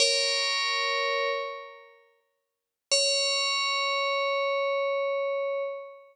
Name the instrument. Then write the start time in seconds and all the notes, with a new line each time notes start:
tubular bells
0.00 A#4 C#5
2.91 C#5